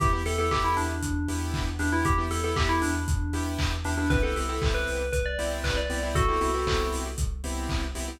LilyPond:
<<
  \new Staff \with { instrumentName = "Tubular Bells" } { \time 4/4 \key e \minor \tempo 4 = 117 g'16 r16 a'16 a'16 g'16 e'16 d'2 d'16 e'16 | g'16 r16 a'16 a'16 g'16 e'16 d'2 d'16 d'16 | b'16 a'4 b'8. b'16 d''8 r16 b'16 d''8 r16 | <fis' a'>4. r2 r8 | }
  \new Staff \with { instrumentName = "Lead 2 (sawtooth)" } { \time 4/4 \key e \minor <b e' g'>16 <b e' g'>16 <b e' g'>16 <b e' g'>16 <b e' g'>4. <b e' g'>4 <b e' g'>16 <b e' g'>16~ | <b e' g'>16 <b e' g'>16 <b e' g'>16 <b e' g'>16 <b e' g'>4. <b e' g'>4 <b e' g'>16 <b e' g'>16 | <b c' e' g'>16 <b c' e' g'>16 <b c' e' g'>16 <b c' e' g'>16 <b c' e' g'>4. <b c' e' g'>4 <b c' e' g'>16 <b c' e' g'>16~ | <b c' e' g'>16 <b c' e' g'>16 <b c' e' g'>16 <b c' e' g'>16 <b c' e' g'>4. <b c' e' g'>4 <b c' e' g'>16 <b c' e' g'>16 | }
  \new Staff \with { instrumentName = "Synth Bass 2" } { \clef bass \time 4/4 \key e \minor e,8 e,8 e,8 e,8 e,8 e,8 e,8 e,8 | e,8 e,8 e,8 e,8 e,8 e,8 e,8 e,8 | c,8 c,8 c,8 c,8 c,8 c,8 c,8 c,8 | c,8 c,8 c,8 c,8 c,8 c,8 c,8 c,8 | }
  \new DrumStaff \with { instrumentName = "Drums" } \drummode { \time 4/4 <hh bd>8 hho8 <hc bd>8 hho8 <hh bd>8 hho8 <hc bd>8 hho8 | <hh bd>8 hho8 <hc bd>8 hho8 <hh bd>8 hho8 <hc bd>8 hho8 | <hh bd>8 hho8 <hc bd>8 hho8 <hh bd>8 hho8 <hc bd>8 hho8 | <hh bd>8 hho8 <hc bd>8 hho8 <hh bd>8 hho8 <hc bd>8 hho8 | }
>>